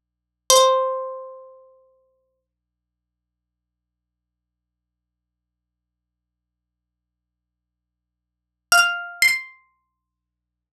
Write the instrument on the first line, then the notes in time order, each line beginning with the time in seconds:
acoustic guitar (steel)
0.50 C5
8.72 F5
9.22 C6